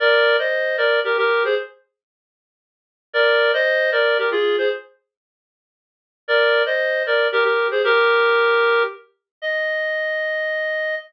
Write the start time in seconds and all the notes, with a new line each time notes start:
0.00 A#4 D5
0.39 C5 D#5
0.78 A#4 D5
1.04 G4 A#4
1.17 G4 A#4
1.45 G#4 C5
3.13 A#4 D5
3.53 C5 D#5
3.92 A#4 D5
4.18 G4 A#4
4.31 F4 G#4
4.58 G#4 C5
6.28 A#4 D5
6.66 C5 D#5
7.06 A#4 D5
7.32 G4 A#4
7.44 G4 A#4
7.71 G#4 C5
7.84 G4 A#4
9.42 D#5